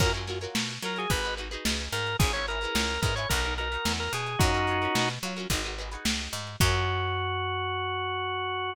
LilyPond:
<<
  \new Staff \with { instrumentName = "Drawbar Organ" } { \time 4/4 \key fis \mixolydian \tempo 4 = 109 ais'16 r4 r16 ais'16 gis'16 b'8 r4 ais'8 | gis'16 cis''16 ais'4 ais'16 cis''16 ais'8 ais'8. ais'16 gis'8 | <dis' fis'>4. r2 r8 | fis'1 | }
  \new Staff \with { instrumentName = "Acoustic Guitar (steel)" } { \time 4/4 \key fis \mixolydian <eis' fis' ais' cis''>16 <eis' fis' ais' cis''>16 <eis' fis' ais' cis''>16 <eis' fis' ais' cis''>8. <eis' fis' ais' cis''>16 <eis' fis' ais' cis''>16 <dis' fis' gis' b'>16 <dis' fis' gis' b'>16 <dis' fis' gis' b'>16 <dis' fis' gis' b'>4~ <dis' fis' gis' b'>16 | <cis' e' gis' b'>16 <cis' e' gis' b'>16 <cis' e' gis' b'>16 <cis' e' gis' b'>8. <cis' e' gis' b'>16 <cis' e' gis' b'>16 <dis' fis' ais' b'>16 <dis' fis' ais' b'>16 <dis' fis' ais' b'>16 <dis' fis' ais' b'>4~ <dis' fis' ais' b'>16 | <cis' eis' fis' ais'>16 <cis' eis' fis' ais'>16 <cis' eis' fis' ais'>16 <cis' eis' fis' ais'>8. <cis' eis' fis' ais'>16 <cis' eis' fis' ais'>16 <dis' fis' gis' b'>16 <dis' fis' gis' b'>16 <dis' fis' gis' b'>16 <dis' fis' gis' b'>4~ <dis' fis' gis' b'>16 | <eis' fis' ais' cis''>1 | }
  \new Staff \with { instrumentName = "Electric Bass (finger)" } { \clef bass \time 4/4 \key fis \mixolydian fis,4 b,8 fis8 gis,,4 cis,8 gis,8 | gis,,4 cis,8 gis,8 b,,4 e,8 b,8 | fis,4 b,8 fis8 gis,,4 cis,8 gis,8 | fis,1 | }
  \new DrumStaff \with { instrumentName = "Drums" } \drummode { \time 4/4 <cymc bd>16 hh16 <hh sn>16 hh16 sn16 hh16 hh16 hh16 <hh bd>16 hh16 hh16 hh16 sn16 hh16 <hh sn>16 hh16 | <hh bd>16 hh16 hh16 hh16 sn16 hh16 <hh bd>16 hh16 <hh bd>16 hh16 hh16 hh16 sn16 hh16 hh16 hh16 | <hh bd>16 hh16 hh16 hh16 sn16 hh16 hh16 hh16 <hh bd>16 hh16 hh16 hh16 sn16 hh16 hh16 hh16 | <cymc bd>4 r4 r4 r4 | }
>>